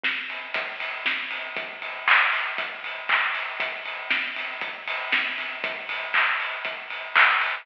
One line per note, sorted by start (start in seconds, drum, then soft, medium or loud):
0.03 kick medium
0.03 snare medium
0.30 open hi-hat medium
0.54 kick medium
0.54 closed hi-hat loud
0.80 open hi-hat medium
1.06 kick medium
1.06 snare medium
1.31 open hi-hat medium
1.57 kick medium
1.57 closed hi-hat medium
1.82 open hi-hat medium
2.08 kick medium
2.08 clap loud
2.33 open hi-hat medium
2.58 kick medium
2.58 closed hi-hat medium
2.84 open hi-hat medium
3.09 kick medium
3.09 clap medium
3.34 open hi-hat medium
3.60 kick medium
3.60 closed hi-hat loud
3.85 open hi-hat medium
4.10 kick medium
4.10 snare medium
4.36 open hi-hat medium
4.61 kick medium
4.61 closed hi-hat medium
4.88 open hi-hat medium
5.12 kick medium
5.12 snare medium
5.38 open hi-hat medium
5.64 kick loud
5.64 closed hi-hat medium
5.89 open hi-hat medium
6.14 kick medium
6.14 clap medium
6.40 open hi-hat medium
6.65 kick medium
6.65 closed hi-hat medium
6.90 open hi-hat medium
7.16 kick medium
7.16 clap loud
7.41 open hi-hat medium